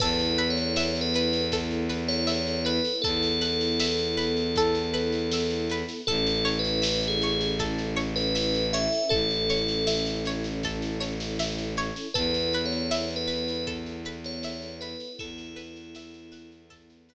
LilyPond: <<
  \new Staff \with { instrumentName = "Tubular Bells" } { \time 4/4 \key e \mixolydian \tempo 4 = 79 \tuplet 3/2 { b'4 cis''4 b'4 } r8. cis''8. b'8 | a'1 | \tuplet 3/2 { a'4 b'4 gis'4 } r8. b'8. e''8 | a'4. r2 r8 |
\tuplet 3/2 { b'4 cis''4 b'4 } r8. cis''8. b'8 | e'2 r2 | }
  \new Staff \with { instrumentName = "Orchestral Harp" } { \time 4/4 \key e \mixolydian a'8 b'8 e''8 b'8 a'8 b'8 e''8 b'8 | a'8 b'8 e''8 b'8 a'8 b'8 e''8 b'8 | a'8 cis''8 e''8 cis''8 a'8 cis''8 e''8 cis''8 | a'8 cis''8 e''8 cis''8 a'8 cis''8 e''8 cis''8 |
a'8 b'8 e''8 b'8 a'8 b'8 e''8 b'8 | a'8 b'8 e''8 b'8 a'8 b'8 r4 | }
  \new Staff \with { instrumentName = "String Ensemble 1" } { \time 4/4 \key e \mixolydian <b e' a'>1~ | <b e' a'>1 | <cis' e' a'>1~ | <cis' e' a'>1 |
<b e' a'>1~ | <b e' a'>1 | }
  \new Staff \with { instrumentName = "Violin" } { \clef bass \time 4/4 \key e \mixolydian e,1 | e,1 | a,,1 | a,,1 |
e,1 | e,1 | }
  \new DrumStaff \with { instrumentName = "Drums" } \drummode { \time 4/4 <cymc bd sn>16 sn16 sn16 sn16 sn16 sn16 sn16 sn16 <bd sn>16 sn16 sn16 sn16 sn16 sn16 sn16 sn16 | <bd sn>16 sn16 sn16 sn16 sn16 sn16 sn16 sn16 <bd sn>16 sn16 sn16 sn16 sn16 sn16 sn16 sn16 | <bd sn>16 sn16 sn16 sn16 sn16 sn16 sn16 sn16 <bd sn>16 sn16 sn16 sn16 sn16 sn16 sn16 sn16 | <bd sn>16 sn16 sn16 sn16 sn16 sn16 sn16 sn16 <bd sn>16 sn16 sn16 sn16 sn16 sn16 sn16 sn16 |
<bd sn>16 sn16 sn16 sn16 sn16 sn16 sn16 sn16 <bd sn>16 sn16 sn16 sn16 sn16 sn16 sn16 sn16 | <bd sn>16 sn16 sn16 sn16 sn16 sn16 sn16 sn16 <bd sn>16 sn16 sn8 r4 | }
>>